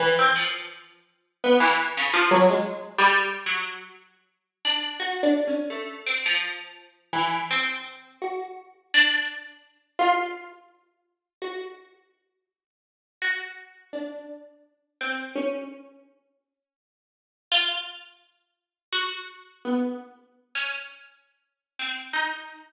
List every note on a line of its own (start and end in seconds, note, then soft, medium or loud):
0.00 0.14 E3 loud
0.19 0.35 C4 medium
0.36 1.32 F3 medium
1.44 1.60 B3 medium
1.60 1.76 E3 medium
1.97 2.13 C#3 medium
2.14 2.30 F3 loud
2.31 2.47 F#3 loud
2.49 2.92 G#3 medium
2.98 3.41 G3 loud
3.46 3.89 F#3 medium
4.65 4.97 D4 medium
5.00 5.21 F#4 medium
5.23 5.44 D4 medium
5.47 5.69 C#4 medium
5.70 6.02 A3 medium
6.07 6.23 C4 medium
6.26 7.06 F3 medium
7.13 7.45 E3 medium
7.51 8.15 C4 medium
8.22 8.54 F#4 medium
8.94 9.58 D4 loud
9.99 11.28 F4 loud
11.42 11.74 F#4 medium
13.22 13.86 F#4 medium
13.93 14.89 D4 medium
15.01 15.33 C4 medium
15.36 16.00 C#4 medium
17.52 17.84 F4 loud
18.93 19.41 F#4 medium
19.65 19.97 B3 medium
20.55 20.71 C#4 medium
21.79 22.11 C4 medium
22.13 22.46 D#4 medium